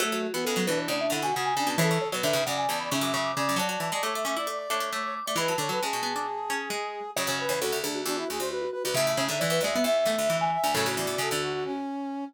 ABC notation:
X:1
M:4/4
L:1/16
Q:1/4=134
K:F#m
V:1 name="Vibraphone"
F F F F A2 B c d e f g f g g a | c c c c e2 f g a b c' d' c' d' d' d' | a a a a d'2 d' d' d' d' d' d' d' d' d' d' | b a11 z4 |
c c c c A2 G F F F F F F F F F | e e c2 d B d e e e e3 g2 g | A F F8 z6 |]
V:2 name="Brass Section"
A,3 B,3 D2 D D E F F2 D2 | A3 B3 d2 d d e e e2 d2 | d d2 d c e e d d2 c2 c c z d | B2 c B G12 |
c c B2 F2 D2 D E G =c B2 B B | e3 e3 e2 e e e e e2 e2 | c2 d d A2 F F C6 z2 |]
V:3 name="Pizzicato Strings"
A,2 z B, G, F, E,2 C,2 D,2 C,2 C,2 | E,2 z F, D, C, C,2 C,2 C,2 C,2 C,2 | F,2 E, G, A,2 C E z2 D2 A,3 z | E,2 D, F, G,2 B, D z2 C2 G,3 z |
C, C,7 z8 | C,2 C, D, E,2 G, B, z2 A,2 E,3 z | [A,,C,]4 C, D,3 z8 |]
V:4 name="Harpsichord"
F, F,2 E, C, C, B,,2 A,,2 C, B,,3 z B,, | C, C,2 B,, G,, G,, F,,2 E,,2 G,, F,,3 z F,, | F, F,2 G, A, A, A,2 A,2 A, A,3 z A, | G, F, D,2 C, B,,9 z2 |
F,, F,,2 E,, D,, D,, D,,2 E,,2 D,, D,,3 z D,, | A,, A,,2 G,, E,, E,, D,,2 E,,2 E,, D,,3 z D,, | F,, D,, E,, E,, F,, D,,5 z6 |]